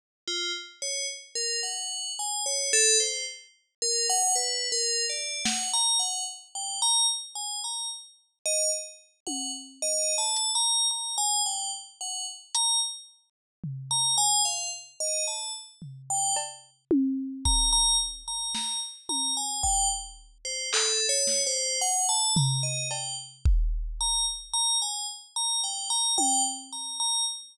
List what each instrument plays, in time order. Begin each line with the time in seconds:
0.27 tubular bells F4
0.82 tubular bells C#5
1.35 tubular bells A#4
1.63 tubular bells F#5
2.19 tubular bells G#5
2.46 tubular bells C#5
2.73 tubular bells A4
3.00 tubular bells C5
3.82 tubular bells A#4
4.10 tubular bells F#5
4.35 tubular bells B4
4.72 tubular bells A#4
5.10 tubular bells D5
5.45 tubular bells F#5, snare
5.73 tubular bells A#5
5.99 tubular bells F#5
6.55 tubular bells G5
6.82 tubular bells A#5
7.35 tubular bells G#5
7.64 tubular bells A#5
8.46 tubular bells D#5
9.27 tubular bells F#5, high tom
9.82 tubular bells D#5
10.18 tubular bells A5
10.36 closed hi-hat
10.55 tubular bells A#5
10.91 tubular bells A#5
11.18 tubular bells G#5
11.46 tubular bells G5
12.01 tubular bells F#5
12.55 tubular bells A#5, closed hi-hat
13.64 floor tom
13.91 tubular bells A#5
14.18 tubular bells G#5
14.45 tubular bells F5
15.00 tubular bells D#5
15.27 tubular bells A5
15.82 floor tom
16.10 tubular bells G5
16.36 cowbell
16.91 high tom
17.45 tubular bells A#5, kick
17.72 tubular bells A#5
18.28 tubular bells A#5
18.55 tubular bells A#5, snare
19.09 tubular bells A#5, high tom
19.37 tubular bells G#5
19.63 tubular bells G5, kick
20.45 tubular bells C5
20.73 tubular bells A4, clap
21.09 tubular bells C#5
21.27 snare
21.47 tubular bells C5
21.81 tubular bells F#5
22.09 tubular bells A5
22.36 tubular bells A#5, floor tom
22.63 tubular bells D#5
22.91 tubular bells G5, cowbell
23.45 kick
24.01 tubular bells A#5
24.53 tubular bells A#5
24.82 tubular bells G#5
25.36 tubular bells A#5
25.64 tubular bells G5
25.90 tubular bells A#5
26.18 tubular bells G5, high tom
26.72 tubular bells A#5
27.00 tubular bells A#5